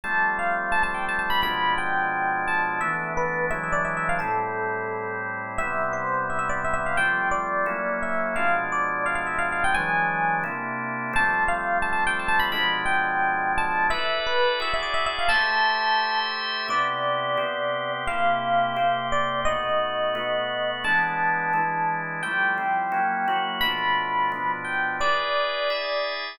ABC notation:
X:1
M:4/4
L:1/8
Q:1/4=173
K:Am
V:1 name="Electric Piano 1"
a2 f2 (3a a g (3a a b | b2 g4 a2 | e2 B2 (3e e d (3e e f | A6 z2 |
e2 c2 (3e e d (3e e f | g2 d4 e2 | f2 d2 (3f f e (3f f g | ^g4 z4 |
a2 f2 (3a a g (3a a b | b2 g4 a2 | e2 B2 (3e e d (3e e f | a6 z2 |
d8 | f6 d2 | ^d8 | a7 z |
g8 | b6 g2 | d8 |]
V:2 name="Drawbar Organ"
[F,G,A,C]8 | [B,,F,_A,D]8 | [E,A,B,D]4 [E,^F,^G,D]4 | [A,,G,CE]8 |
[C,G,B,E]8 | [F,G,A,C]4 [^F,^A,^CE]4 | [B,,F,_A,D]8 | [E,^F,^G,D]4 [C,_B,DE]4 |
[F,G,A,C]8 | [B,,F,_A,D]8 | [EABd]4 [E^F^Gd]4 | [A,Gce]8 |
[C,B,EG]4 [C,B,CG]4 | [C,_B,EG]4 [C,B,CG]4 | [B,,A,^D^F]4 [B,,A,B,F]4 | [E,^G,B,D]4 [E,G,DE]4 |
[F,G,A,E]2 [F,G,CE]2 [^F,^A,^CE]2 [F,A,E^F]2 | [B,,F,A,D]4 [B,,F,B,D]4 | [E^GBd]4 [EGde]4 |]